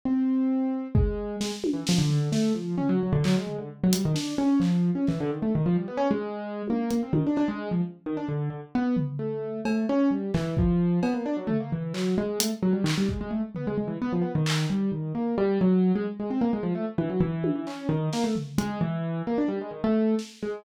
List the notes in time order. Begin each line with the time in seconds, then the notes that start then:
0.05 C4
0.95 G#3, kick
1.41 G#3, snare
1.64 high tom
1.73 E3
1.87 F3, snare
1.98 D3
2.10 floor tom
2.32 A3, snare
2.54 F3
2.77 C#4, floor tom
2.89 F#3
3.03 F#3
3.12 D3
3.24 F#3, clap
3.36 G#3
3.47 floor tom
3.58 D3
3.83 F#3
3.93 G3, closed hi-hat
4.05 D#3
4.14 D4, snare
4.38 C#4
4.60 F3, clap
4.95 C#4
5.07 E3, clap
5.20 D3
5.30 D#3
5.42 A3
5.55 D#3
5.66 F3
5.76 G3
5.88 B3
5.97 C#4
6.11 G#3
6.68 A#3, high tom
6.91 A#3, closed hi-hat
7.03 C4
7.13 D#3, high tom
7.26 D4
7.36 D4, cowbell
7.48 G#3
7.71 F3
8.06 D#3
8.17 D4
8.28 D3
8.50 D3
8.75 B3
8.97 floor tom
9.19 A3
9.65 A3, cowbell
9.89 C#4
10.11 G3
10.34 E3, clap
10.57 F3, kick
11.03 B3, cowbell
11.14 A#3
11.26 D4
11.36 F#3
11.47 A3, floor tom
11.60 A#3
11.72 E3
11.94 F#3, clap
12.18 G#3
12.40 A3, closed hi-hat
12.62 F#3
12.73 G3
12.84 D#3, clap
12.98 G3
13.09 G#3, kick
13.21 G#3
13.31 A3
13.55 B3, floor tom
13.67 G#3
13.77 G#3
13.87 E3
14.02 B3
14.12 F3
14.22 B3
14.35 D#3
14.46 clap
14.69 G3, cowbell
14.92 D#3
15.15 A#3
15.38 G3
15.61 F#3
15.95 G#3
16.19 G#3
16.30 C4
16.41 A#3
16.53 G#3
16.63 F3
16.75 A3
16.98 E3, high tom
17.10 F#3
17.20 E3
17.44 high tom
17.55 E3
17.67 C#4, clap
17.89 D#3
18.13 A#3, snare
18.24 A3
18.36 floor tom
18.58 G#3, closed hi-hat
18.81 E3
19.27 A#3
19.38 D4
19.48 G3
19.61 G#3
19.71 D#3
19.84 A3
20.19 snare
20.42 G#3